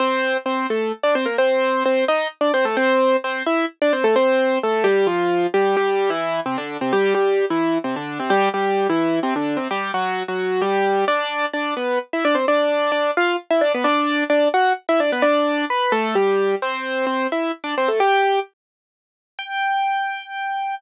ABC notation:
X:1
M:3/4
L:1/16
Q:1/4=130
K:F
V:1 name="Acoustic Grand Piano"
[Cc]4 [Cc]2 [A,A]2 z [Dd] [Cc] [B,B] | [Cc]4 [Cc]2 [_E_e]2 z [Dd] [Cc] [A,A] | [Cc]4 [Cc]2 [Ee]2 z [Dd] [Cc] [A,A] | [Cc]4 [A,A]2 [G,G]2 [F,F]4 |
[K:C] [G,G]2 [G,G]3 [E,E]3 [C,C] [D,D]2 [C,C] | [G,G]2 [G,G]3 [E,E]3 [C,C] [D,D]2 [C,C] | [G,G]2 [G,G]3 [E,E]3 [C,C] [D,D]2 [C,C] | [G,G]2 [^F,^F]3 [F,F]3 [G,G]4 |
[K:G] [Dd]4 [Dd]2 [B,B]2 z [Ee] [Dd] [Cc] | [Dd]4 [Dd]2 [=F=f]2 z [Ee] [Dd] [B,B] | [Dd]4 [Dd]2 [Ff]2 z [Ee] [Dd] [B,B] | [Dd]4 [Bb]2 [A,A]2 [G,G]4 |
[Cc]4 [Cc]2 [Ee]2 z [Dd] [Cc] [A,A] | [Gg]4 z8 | g12 |]